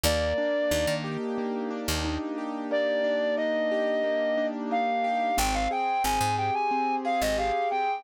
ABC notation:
X:1
M:4/4
L:1/16
Q:1/4=90
K:Bbdor
V:1 name="Brass Section"
=d6 z10 | =d4 e8 f4 | g f g2 a2 g a3 f e f2 g2 |]
V:2 name="Acoustic Grand Piano"
B,2 =D2 E2 G2 B,2 D2 E2 G2 | B,2 =D2 E2 G2 B,2 D2 E2 G2 | C2 A2 C2 G2 C2 A2 G2 C2 |]
V:3 name="Electric Bass (finger)" clef=bass
E,,4 E,, E,6 E,,5- | E,,16 | A,,,4 A,,, A,,6 A,,,5 |]